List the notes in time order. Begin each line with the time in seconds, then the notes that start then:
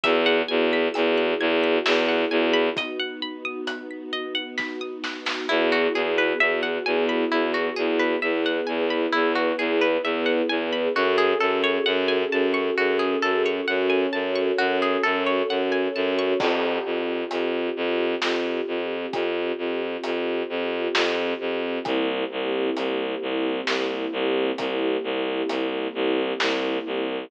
0.04 E2 B3 E4 F#4 G#4 E5, kick, closed hi-hat
0.26 F#5
0.48 E2 G#5
0.73 B5
0.94 E2 E6, closed hi-hat
1.18 F#6
1.40 E2 G#6
1.64 B6
1.86 E2 E5, snare
2.09 F#5
2.31 E2 G#5
2.54 B5
2.77 B3 D#4 F#4 D#5, kick, closed hi-hat
3.00 F#5
3.22 B5
3.45 D#6
3.67 F#6, closed hi-hat
3.91 B6
4.13 D#5
4.35 F#5
4.58 B5, kick, snare
4.81 D#6
5.04 F#6, snare
5.26 B6, snare
5.49 E2 B3 E4 F#4 G#4
5.72 F#4
5.94 E2 G#4
6.18 B4
6.40 E2 E5
6.63 F#5
6.86 E2 G#5
7.09 B5
7.31 E2 E4
7.54 F#4
7.76 E2 G#4
7.99 B4
8.22 E2 B3 E4 G#4 B4 E5
8.46 F#5
8.67 E2 G#5
8.90 B5
9.13 E2 E4
9.35 F#4
9.59 E2 G#4
9.81 B4
10.03 E2 E5
10.26 F#5
10.49 E2 G#5
10.73 B5
10.95 F#2 C#4 F#4 G#4 A4
11.18 G#4
11.40 F#2 A4
11.64 C#5
11.86 F#2 F#5
12.08 G#5
12.32 F#2 A5
12.54 C#6
12.77 F#2 F#4
12.99 G#4
13.22 F#2 A4
13.46 C#5
13.68 F#2 C#4 F#4 A4 C#5 F#5
13.90 G#5
14.13 F#2 A5
14.36 C#6
14.58 F#2 F#4
14.82 G#4
15.03 F#2 A4
15.27 C#5
15.49 F#2 F#5
15.72 G#5
15.95 F#2 A5
16.19 C#6
16.40 F2 C4 F4 G4, kick, crash
16.85 F2
17.31 F2, closed hi-hat
17.77 F2
18.22 F2, snare
18.68 F2
19.13 F2, kick, closed hi-hat
19.58 F2
20.04 F2, closed hi-hat
20.49 F2
20.95 F2, snare
21.40 F2
21.85 C2 A#3 C4 E4 G4, kick, closed hi-hat
22.32 C2
22.77 C2, closed hi-hat
23.22 C2
23.67 C2, snare
24.13 C2
24.58 C2, kick, closed hi-hat
25.04 C2
25.49 C2, closed hi-hat
25.95 C2
26.40 C2, snare
26.86 C2